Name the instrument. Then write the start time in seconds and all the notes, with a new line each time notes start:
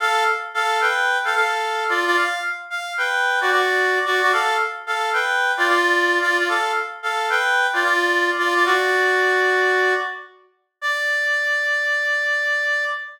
clarinet
0.00 A4 F5
0.54 A4 F5
0.81 B4 G5
1.25 A4 F5
1.35 A4 F5
1.89 F4 D5
2.06 F4 D5
2.16 F5
2.70 F5
2.98 B4 G5
3.41 F#4 D5
3.51 F#4 D5
4.06 F#4 D5
4.22 F#4 D5
4.33 A4 F5
4.87 A4 F5
5.13 B4 G5
5.57 F4 D5
5.67 F4 D5
6.21 F4 D5
6.38 F4 D5
6.49 A4 F5
7.03 A4 F5
7.30 B4 G5
7.73 F4 D5
7.84 F4 D5
8.38 F4 D5
8.55 F4 D5
8.65 F#4 D5
10.81 D5